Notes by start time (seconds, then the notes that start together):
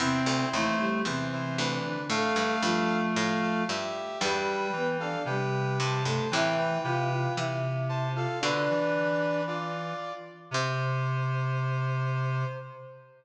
0.00 E2 C3 C4 E4 C5
0.26 D2
0.53 D#2 E3 A3 E4
0.79 G3 G4
1.05 E2 C3 E3 C4 E4 C5
1.32 E4 C5
1.58 D2 D4 B4
1.86 D3 D4
2.09 A2 A3 A4 F5
2.36 G2
2.62 G2 F3 F4
3.16 A2 A4 F5
3.41 A4 F5
3.69 G2 G4 E5
4.21 E2 G2 G3 G4 B4 G5
4.72 E3 B3 B4
5.00 D4 A4 D5 F5
5.25 C3 G3 G4 B4 G5
5.79 G2 C5 A5
6.05 G2 A3 A4
6.31 A2 C3 E3 E4 B4 E5 G5
6.58 B4 G5
6.84 C3 F4 B4 F5 G5
7.11 F4 F5
7.36 C3 E3 E4 E5
7.89 C5 A5
8.14 F4 A4 F5
8.40 B2 D3 D4 B4 D5
8.70 E3
9.47 F4 D5
10.51 C3 C5